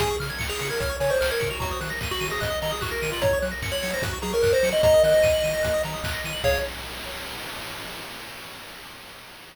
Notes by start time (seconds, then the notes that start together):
0.00 C#2 G#4 G#5, kick, closed hi-hat
0.10 C#6
0.20 C#3 F6, open hi-hat
0.30 G#6
0.39 C#2 C#7, kick, clap
0.49 G#4 F7
0.59 C#3 C#7, open hi-hat
0.69 A#4 G#6
0.80 C#2 C#5 F6, kick, closed hi-hat
0.89 C#6
1.00 C#3 C#5 G#5, open hi-hat
1.09 C5 C#6
1.21 C#2 C5 F6, clap
1.31 A#4 G#6
1.40 C#3 C#7, kick, open hi-hat
1.50 F#4 F7
1.60 D#2 F#4 A#5, kick, closed hi-hat
1.71 D#6
1.81 D#3 F#6, open hi-hat
1.90 A#6
2.01 D#2 D#7, kick, clap
2.11 F#4 F#7
2.20 D#3 D#7, open hi-hat
2.30 G#4 A#6
2.40 D#2 D#5 F#6, kick, closed hi-hat
2.50 D#6
2.62 D#3 D#5 A#5, open hi-hat
2.71 G#4 D#6
2.81 D#2 F#4 F#6, kick, clap
2.91 A#4 A#6
3.02 D#3 D#7, open hi-hat
3.12 F4 F#7
3.21 F#2 C#5 A#5, kick, closed hi-hat
3.33 C#6
3.42 F#3 F#6, open hi-hat
3.51 A#6
3.62 F#2 C#7, kick, clap
3.72 C#5 F#7
3.82 F#3 C#7, open hi-hat
3.93 C5 A#6
4.02 F#2 F#4 F#6, kick, closed hi-hat
4.13 C#6
4.22 F#3 G#4 A#5, open hi-hat
4.33 A#4 C#6
4.42 F#2 A#4 F#6, kick, clap
4.53 C5 A#6
4.63 F#3 C#7, open hi-hat
4.72 D#5 F#7
4.83 D#2 D#5 A#5, kick, closed hi-hat
4.94 D#6
5.03 D#3 D#5 F#6, open hi-hat
5.14 A#6
5.23 D#2 D#7, kick, clap
5.33 F#7
5.43 D#3 D#7, open hi-hat
5.53 A#6
5.63 D#2 F#6, kick, closed hi-hat
5.74 D#6
5.83 D#3 A#5, open hi-hat
5.94 D#6
6.04 D#2 F#6, kick, clap
6.13 A#6
6.24 D#3 D#7, open hi-hat
6.33 F#7
6.44 C#2 G#4 C#5 F5, kick, crash